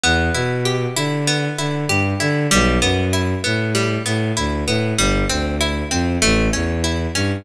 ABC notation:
X:1
M:4/4
L:1/8
Q:1/4=97
K:Em
V:1 name="Orchestral Harp"
B, E G E B, E G E | G, B, E B, G, B, E B, | G, C E C A, ^C E C |]
V:2 name="Violin" clef=bass
E,, B,,2 D,2 D, G,, D, | B,,, F,,2 A,,2 A,, D,, A,, | G,,, D,,2 =F,, A,,, E,,2 G,, |]